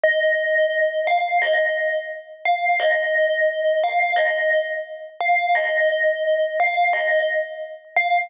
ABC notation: X:1
M:4/4
L:1/8
Q:1/4=87
K:Ab
V:1 name="Tubular Bells"
e3 f e z2 f | e3 f e z2 f | e3 f e z2 f |]